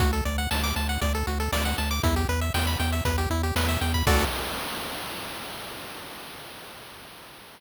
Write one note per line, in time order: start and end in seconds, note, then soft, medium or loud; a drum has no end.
0.00 0.21 D2 loud
0.00 0.11 F#4 loud
0.00 kick loud
0.00 closed hi-hat loud
0.13 0.24 A4 medium
0.13 closed hi-hat medium
0.25 0.47 D2 medium
0.25 0.37 D5 medium
0.25 closed hi-hat medium
0.38 0.49 F#5 medium
0.38 closed hi-hat medium
0.51 0.73 D2 medium
0.51 0.62 A5 medium
0.51 snare loud
0.63 0.75 D6 medium
0.63 closed hi-hat medium
0.76 0.98 D2 medium
0.76 0.88 A5 medium
0.76 closed hi-hat medium
0.89 1.00 F#5 medium
0.89 closed hi-hat medium
1.01 1.23 D2 medium
1.01 1.13 D5 medium
1.01 kick medium
1.01 closed hi-hat medium
1.14 1.26 A4 medium
1.14 closed hi-hat medium
1.27 1.49 D2 medium
1.27 1.38 F#4 medium
1.27 closed hi-hat medium
1.40 1.51 A4 medium
1.40 closed hi-hat medium
1.52 1.74 D2 medium
1.52 1.64 D5 loud
1.52 snare loud
1.65 1.77 F#5 medium
1.65 closed hi-hat medium
1.78 2.00 D2 medium
1.78 1.90 A5 medium
1.78 closed hi-hat medium
1.91 2.02 D6 medium
1.91 closed hi-hat medium
2.03 2.25 E2 loud
2.03 2.15 E4 loud
2.03 kick loud
2.03 closed hi-hat loud
2.16 2.28 G4 medium
2.16 closed hi-hat medium
2.29 2.50 E2 medium
2.29 2.40 B4 loud
2.29 closed hi-hat medium
2.41 2.53 E5 medium
2.41 closed hi-hat medium
2.54 2.76 E2 medium
2.54 2.66 G5 loud
2.54 snare loud
2.67 2.78 B5 medium
2.67 closed hi-hat medium
2.79 3.01 E2 medium
2.79 2.91 G5 medium
2.79 closed hi-hat medium
2.92 3.04 E5 medium
2.92 closed hi-hat medium
3.05 3.27 E2 medium
3.05 3.17 B4 loud
3.05 kick medium
3.05 closed hi-hat loud
3.18 3.29 G4 medium
3.18 closed hi-hat medium
3.30 3.52 E2 medium
3.30 3.42 E4 loud
3.30 closed hi-hat medium
3.43 3.55 G4 medium
3.43 closed hi-hat medium
3.56 3.77 E2 medium
3.56 3.68 B4 medium
3.56 snare loud
3.69 3.80 E5 medium
3.69 closed hi-hat medium
3.81 4.03 E2 medium
3.81 3.93 G5 medium
3.81 closed hi-hat medium
3.94 4.06 B5 medium
3.94 kick medium
3.94 closed hi-hat medium
4.07 4.25 D2 loud
4.07 4.25 F#4 loud
4.07 4.25 A4 loud
4.07 4.25 D5 loud
4.07 kick loud
4.07 crash loud